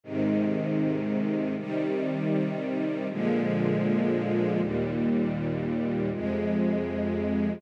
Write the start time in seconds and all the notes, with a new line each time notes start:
0.03 G#2 C3 D#3
1.57 C3 D#3 G3
3.10 A#2 D3 F3 G#3
4.59 D#2 A#2 G3
6.12 F2 C3 G#3